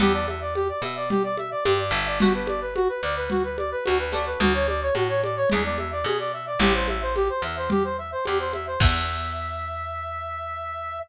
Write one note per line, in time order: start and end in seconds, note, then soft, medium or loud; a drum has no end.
0.00 0.69 E2 medium
0.00 0.40 B3 loud
0.00 0.40 D4 loud
0.00 0.40 E4 loud
0.00 0.13 G4 loud
0.00 0.40 G4 loud
0.00 low conga loud
0.14 0.26 D5 medium
0.28 0.40 E5 medium
0.28 high conga medium
0.41 0.54 D5 medium
0.55 0.68 G4 medium
0.55 high conga medium
0.69 0.82 D5 medium
0.82 1.52 B2 medium
0.82 0.95 E5 medium
0.82 high conga medium
0.96 1.09 D5 medium
1.10 1.23 G4 medium
1.10 low conga medium
1.24 1.36 D5 medium
1.37 1.50 E5 medium
1.37 high conga medium
1.51 1.64 D5 medium
1.65 1.92 G2 medium
1.65 1.78 G4 medium
1.65 high conga loud
1.79 1.92 D5 medium
1.91 2.89 G1 medium
1.91 2.06 E5 medium
2.06 2.19 D5 medium
2.20 2.60 B3 loud
2.20 2.60 D4 loud
2.20 2.33 F#4 medium
2.20 2.60 F#4 loud
2.20 2.60 G4 medium
2.20 low conga loud
2.34 2.47 B4 medium
2.47 2.60 D5 medium
2.47 high conga medium
2.61 2.74 B4 medium
2.75 2.88 F#4 loud
2.75 high conga medium
2.89 3.02 B4 medium
3.03 3.73 D2 medium
3.03 3.15 D5 medium
3.17 3.29 B4 medium
3.30 3.43 F#4 medium
3.30 low conga medium
3.44 3.57 B4 medium
3.58 3.70 D5 medium
3.58 high conga medium
3.72 3.84 B4 loud
3.85 4.34 D2 medium
3.85 3.98 F#4 loud
3.85 high conga medium
3.99 4.12 B4 medium
4.12 4.79 A3 loud
4.12 4.79 C#4 loud
4.12 4.79 D4 medium
4.12 4.79 F#4 loud
4.12 4.25 D5 medium
4.12 high conga medium
4.26 4.39 B4 medium
4.40 4.90 D2 medium
4.40 4.53 F#4 medium
4.40 low conga loud
4.54 4.67 C#5 medium
4.68 4.81 D5 medium
4.68 high conga medium
4.82 4.94 C#5 medium
4.95 5.44 A2 medium
4.95 5.08 F#4 medium
4.95 high conga medium
5.09 5.22 C#5 medium
5.23 5.36 D5 medium
5.23 high conga medium
5.37 5.49 C#5 medium
5.50 6.02 E2 medium
5.50 5.90 G#3 loud
5.50 5.90 B3 loud
5.50 5.90 D4 loud
5.50 5.90 E4 loud
5.50 5.63 G#4 medium
5.50 low conga medium
5.64 5.77 D5 medium
5.78 5.91 E5 medium
5.78 high conga medium
5.92 6.04 D5 medium
6.04 6.54 B2 medium
6.04 6.18 G#4 medium
6.04 high conga medium
6.19 6.32 D5 medium
6.33 6.46 E5 medium
6.47 6.59 D5 medium
6.59 7.30 A1 loud
6.59 6.99 G3 loud
6.59 6.99 A3 loud
6.59 6.99 C4 loud
6.59 6.99 E4 loud
6.59 6.73 G4 loud
6.59 low conga loud
6.74 6.87 C5 medium
6.88 7.01 E5 medium
6.88 high conga medium
7.02 7.15 C5 medium
7.16 7.28 G4 medium
7.16 high conga medium
7.29 7.42 C5 medium
7.42 8.12 E2 medium
7.42 7.56 E5 medium
7.57 7.69 C5 medium
7.70 7.83 G4 loud
7.70 low conga medium
7.84 7.97 C5 medium
7.98 8.11 E5 medium
8.12 8.25 C5 medium
8.25 8.74 E2 medium
8.25 8.38 G4 loud
8.25 high conga medium
8.40 8.52 C5 medium
8.53 8.66 E5 medium
8.53 high conga medium
8.67 8.80 C5 medium
8.80 10.99 E2 loud
8.80 11.00 B3 loud
8.80 11.00 D4 loud
8.80 11.00 E4 medium
8.80 11.00 G4 loud
8.80 10.99 E5 loud
8.80 kick loud
8.80 crash loud